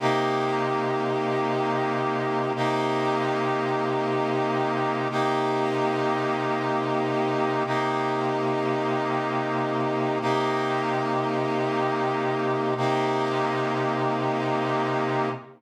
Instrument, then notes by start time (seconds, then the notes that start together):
brass section
0.00 C3 A#3 D#4 G4
2.55 C3 A#3 D#4 G4
5.11 C3 A#3 D#4 G4
7.66 C3 A#3 D#4 G4
10.21 C3 A#3 D#4 G4
12.77 C3 A#3 D#4 G4